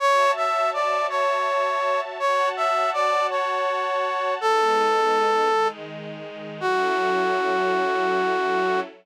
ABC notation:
X:1
M:12/8
L:1/8
Q:3/8=109
K:F#m
V:1 name="Brass Section"
c2 e2 d2 c6 | c2 e2 d2 c6 | A8 z4 | F12 |]
V:2 name="String Ensemble 1"
[Fcea]12 | [Fcfa]12 | [G,B,^D]6 [^D,G,D]6 | [F,CEA]12 |]